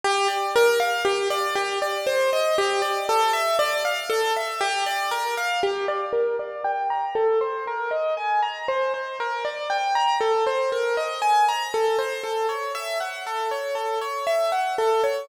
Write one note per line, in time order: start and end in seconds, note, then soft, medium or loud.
0.04 0.28 G4 medium
0.28 0.51 D5 medium
0.56 0.79 A#4 medium
0.80 1.03 F5 medium
1.05 1.28 G4 medium
1.30 1.54 D5 medium
1.55 1.79 G4 medium
1.82 2.05 D5 medium
2.07 2.30 C5 medium
2.33 2.56 D#5 medium
2.58 2.82 G4 medium
2.82 3.05 D5 medium
3.09 3.32 A4 medium
3.33 3.57 E5 medium
3.59 3.82 D5 medium
3.85 4.08 F5 medium
4.10 4.33 A4 medium
4.37 4.60 E5 medium
4.61 4.84 G4 medium
4.86 5.10 D5 medium
5.11 5.35 A#4 medium
5.37 5.61 F5 medium
5.63 5.86 G4 medium
5.88 6.12 D5 medium
6.13 6.36 A#4 medium
6.39 6.63 D5 medium
6.64 6.88 G5 medium
6.90 7.14 A#5 medium
7.15 7.39 A4 medium
7.41 7.64 C5 medium
7.67 7.91 A#4 medium
7.91 8.14 D#5 medium
8.17 8.40 G#5 medium
8.42 8.66 A#5 medium
8.68 8.92 C5 medium
8.94 9.17 C5 medium
9.20 9.43 A#4 medium
9.45 9.68 D5 medium
9.70 9.93 G5 medium
9.95 10.19 A#5 medium
10.21 10.44 A4 medium
10.47 10.70 C5 medium
10.72 10.96 A#4 medium
10.97 11.21 D#5 medium
11.22 11.45 G#5 medium
11.49 11.72 A#5 medium
11.74 11.97 A4 medium
11.99 12.22 C5 medium
12.24 12.47 A4 medium
12.49 12.72 C#5 soft
12.75 12.98 E5 medium
13.00 13.24 F#5 medium
13.27 13.50 A4 medium
13.51 13.75 C#5 medium
13.75 13.99 A4 medium
14.01 14.25 C#5 medium
14.27 14.50 E5 medium
14.52 14.75 F#5 medium
14.78 15.02 A4 medium
15.04 15.27 C#5 medium